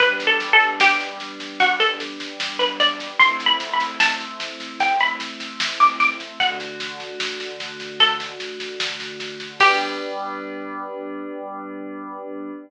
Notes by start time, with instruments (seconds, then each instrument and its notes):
0.00 pad 5 (bowed) G3 B3 D4, pizzicato strings B4, kick, snare
0.20 snare
0.27 pizzicato strings A4
0.40 snare
0.53 pizzicato strings A4
0.60 snare
0.80 pizzicato strings G4, snare
1.00 snare
1.20 snare
1.40 snare
1.60 pizzicato strings F#4, kick, snare
1.80 pizzicato strings A4, snare
2.00 snare
2.20 snare
2.40 snare
2.59 pizzicato strings B4, snare
2.80 pizzicato strings D5, snare
3.00 snare
3.19 pad 5 (bowed) A3 C4 E4, pizzicato strings C6, kick, snare
3.40 snare
3.46 pizzicato strings B5
3.60 snare
3.73 pizzicato strings B5
3.80 snare
4.00 pizzicato strings A5, snare
4.20 snare
4.40 snare
4.60 snare
4.80 pizzicato strings G5, kick, snare
5.00 pizzicato strings B5, snare
5.20 snare
5.40 snare
5.60 snare
5.80 pizzicato strings D6, snare
6.00 pizzicato strings D6, snare
6.20 snare
6.40 pad 5 (bowed) D3 A3 F#4, pizzicato strings F#5, kick, snare
6.60 snare
6.80 snare
7.00 snare
7.20 snare
7.40 snare
7.60 snare
7.80 snare
8.00 pizzicato strings A4, kick, snare
8.20 snare
8.40 snare
8.60 snare
8.80 snare
9.00 snare
9.20 snare
9.40 snare
9.60 pad 5 (bowed) G3 B3 D4, pizzicato strings G4, kick, crash